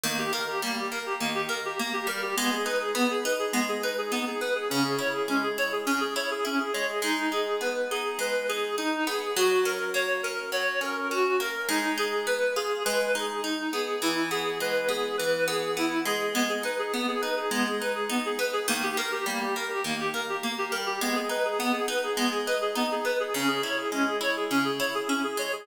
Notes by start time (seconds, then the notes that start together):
0.04 D#3 A#3
0.19 G4
0.33 A#3 A#4
0.49 G4
0.62 G3 A#3
0.77 G4
0.91 A#3 A#4
1.06 G4
1.20 D#3 A#3
1.35 G4
1.49 A#3 A#4
1.65 G4
1.79 A#3
1.93 G4
2.07 G3 A#4
2.22 G4
2.37 G#3 B3
2.52 G#4
2.65 D#4 B4
2.81 G#4
2.95 B3
3.10 G#4
3.25 D#4 B4
3.39 G#4
3.53 G#3 B3
3.69 G#4
3.83 D#4 B4
3.98 G#4
4.12 B3 D#4
4.27 G#4
4.41 B3 B4
4.55 G#4
4.70 C#3 C#4
4.84 G#4
4.99 E4 C#5
5.13 G#4
5.28 G#3 C#4
5.43 G#4
5.58 E4 C#5
5.72 G#4
5.86 C#3 C#4
6.00 G#4
6.16 E4 C#5
6.31 G#4
6.45 C#4 E4
6.60 G#4
6.73 G#3 C#5
6.89 G#4
7.02 G#3 D#4
7.32 D#4 G#4
7.61 B3 B4
7.91 D#4 G#4
8.19 G#3 B4
8.49 D#4 G#4
8.78 D#4
9.07 B3 G#4
9.37 F#3 F#4
9.65 C#4 A#4
9.94 A#3 C#5
10.23 C#4 A#4
10.52 F#3 C#5
10.81 C#4 A#4
11.11 C#4 F#4
11.40 A#3 A#4
11.69 G#3 D#4
11.98 D#4 G#4
12.27 B3 B4
12.56 F4 G#4
12.85 G#3 B4
13.15 D#4 G#4
13.44 D#4
13.73 B3 G#4
14.02 E3 E4
14.31 B3 G#4
14.60 G#3 B4
14.89 B3 G#4
15.18 E3 B4
15.48 B3 G#4
15.77 B3 E4
16.05 G#3 G#4
16.35 G#3 B3
16.49 G#4
16.63 D#4 B4
16.79 G#4
16.94 B3
17.08 G#4
17.21 D#4 B4
17.37 G#4
17.51 G#3 B3
17.66 G#4
17.80 D#4 B4
17.95 G#4
18.10 B3 D#4
18.25 G#4
18.39 B3 B4
18.53 G#4
18.68 D#3 A#3
18.83 G4
18.97 A#3 A#4
19.12 G4
19.26 G3 A#3
19.41 G4
19.56 A#3 A#4
19.70 G4
19.84 D#3 A#3
20.00 G4
20.14 A#3 A#4
20.29 G4
20.43 A#3
20.58 G4
20.71 G3 A#4
20.86 G4
21.01 G#3 B3
21.15 G#4
21.29 D#4 B4
21.45 G#4
21.59 B3
21.73 G#4
21.88 D#4 B4
22.03 G#4
22.17 G#3 B3
22.31 G#4
22.46 D#4 B4
22.61 G#4
22.75 B3 D#4
22.92 G#4
23.05 B3 B4
23.20 G#4
23.34 C#3 C#4
23.48 G#4
23.63 E4 C#5
23.78 G#4
23.92 G#3 C#4
24.07 G#4
24.21 E4 C#5
24.36 G#4
24.51 C#3 C#4
24.65 G#4
24.79 E4 C#5
24.95 G#4
25.08 C#4 E4
25.24 G#4
25.37 G#3 C#5
25.53 G#4